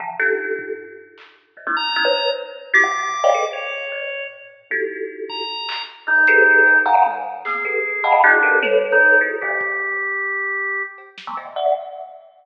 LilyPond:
<<
  \new Staff \with { instrumentName = "Kalimba" } { \time 6/4 \tempo 4 = 153 <c d e f>8 <d' dis' f' g' a'>4. r2 <g, gis, ais, b,>16 <gis ais c' d' dis' e'>16 r8 <b cis' dis' e'>16 <b' c'' cis''>8. | r4 <e' fis' g'>16 <c cis d>4 <c'' cis'' d'' dis'' f'' g''>16 <gis' a' b'>16 r4 r16 <g, a, ais,>2 | <dis' e' fis' g' a'>2 r4. <e, fis, g, a, b,>8 <g' gis' a' b' c''>4 <g, a, b, cis dis e>16 r16 <f'' fis'' gis'' ais''>8 | <f, g, a,>4 <ais b c'>8 <g' a' b'>8 r8 <dis'' f'' fis'' g'' a'' b''>8 <d' dis' e' fis' gis'>8 <g' a' ais' b'>8 <a' b' c'' cis''>4. <e' fis' gis' a'>8 |
<g, gis, ais, c cis dis>2 r2 r8. <dis f g gis a b>16 <ais, b, c d dis>8 <d'' e'' fis''>8 | }
  \new Staff \with { instrumentName = "Drawbar Organ" } { \time 6/4 r1 r8 ais''4. | r4 d'''2 cis''2 r4 | r4. ais''4. r8 dis'2 r8 | r4 gis'2 d'4 r8. dis'8. r8 |
g'1 r2 | }
  \new DrumStaff \with { instrumentName = "Drums" } \drummode { \time 6/4 tomfh4 r8 tomfh8 r4 hc4 r4 hh4 | r4 r4 r4 r4 r4 r4 | tommh4 r8 bd8 r8 hc8 r4 hh4 cb4 | tommh4 hc8 bd8 r4 r4 tommh4 r4 |
r8 bd8 r4 r4 r4 cb8 sn8 cb4 | }
>>